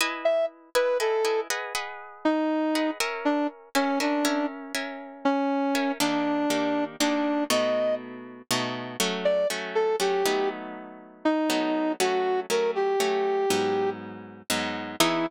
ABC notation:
X:1
M:12/8
L:1/8
Q:3/8=80
K:E
V:1 name="Brass Section"
z e z B A2 z3 D3 | z =D z C D2 z3 C3 | =D4 D2 ^d2 z4 | z =d z A =G2 z3 ^D3 |
F2 ^A =G5 z4 | E3 z9 |]
V:2 name="Acoustic Guitar (steel)"
[EBdg]3 [EBdg] [EBdg] [EBdg] [GBdf] [GBdf]4 [GBdf] | [C^Aeg]3 [CAeg] [CAeg] [CAeg]2 [CAeg]4 [CAeg] | [D,^A,=D=G]2 [^D,A,=DG]2 [^D,A,=DG]2 [B,,=A,^DF]4 [B,,A,DF]2 | [F,A,C]2 [F,A,C]2 [F,A,C] [F,A,B,D]5 [F,A,B,D]2 |
[F,A,C]2 [F,A,C]2 [F,A,C]2 [G,,F,B,D]4 [G,,F,B,D]2 | [E,B,DG]3 z9 |]